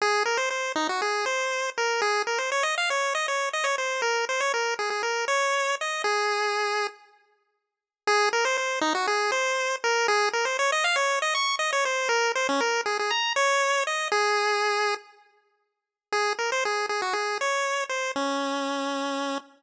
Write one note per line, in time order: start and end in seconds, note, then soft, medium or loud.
0.02 0.23 G#4 loud
0.26 0.38 A#4 medium
0.37 0.49 C5 medium
0.51 0.72 C5 medium
0.76 0.88 D#4 medium
0.89 1.01 F#4 medium
1.02 1.25 G#4 medium
1.26 1.70 C5 medium
1.78 2.01 A#4 medium
2.02 2.22 G#4 medium
2.27 2.39 A#4 medium
2.38 2.50 C5 medium
2.52 2.64 C#5 medium
2.63 2.75 D#5 medium
2.78 2.90 F5 medium
2.90 3.14 C#5 medium
3.15 3.27 D#5 medium
3.28 3.49 C#5 medium
3.53 3.65 D#5 medium
3.64 3.76 C#5 medium
3.78 4.01 C5 medium
4.02 4.25 A#4 medium
4.29 4.41 C5 medium
4.40 4.52 C#5 medium
4.54 4.74 A#4 medium
4.79 4.90 G#4 medium
4.90 5.02 G#4 medium
5.03 5.25 A#4 medium
5.28 5.75 C#5 medium
5.81 6.02 D#5 medium
6.04 6.87 G#4 medium
8.07 8.29 G#4 loud
8.33 8.45 A#4 medium
8.45 8.57 C5 medium
8.57 8.79 C5 medium
8.81 8.93 D#4 medium
8.95 9.07 F#4 medium
9.07 9.31 G#4 medium
9.32 9.76 C5 medium
9.84 10.07 A#4 medium
10.08 10.29 G#4 loud
10.33 10.45 A#4 medium
10.45 10.57 C5 medium
10.59 10.71 C#5 medium
10.72 10.84 D#5 medium
10.84 10.96 F5 medium
10.96 11.19 C#5 medium
11.22 11.34 D#5 medium
11.35 11.56 C#6 medium
11.59 11.71 D#5 medium
11.73 11.85 C#5 medium
11.85 12.09 C5 medium
12.09 12.32 A#4 medium
12.35 12.47 C5 medium
12.49 12.61 C#4 medium
12.61 12.81 A#4 medium
12.86 12.98 G#4 medium
12.99 13.11 G#4 medium
13.11 13.33 A#5 medium
13.36 13.84 C#5 medium
13.87 14.08 D#5 medium
14.12 14.95 G#4 loud
16.12 16.33 G#4 medium
16.39 16.51 A#4 medium
16.52 16.64 C5 medium
16.65 16.86 G#4 medium
16.89 17.01 G#4 medium
17.02 17.14 F#4 medium
17.13 17.38 G#4 medium
17.41 17.84 C#5 medium
17.89 18.12 C5 medium
18.16 19.38 C#4 medium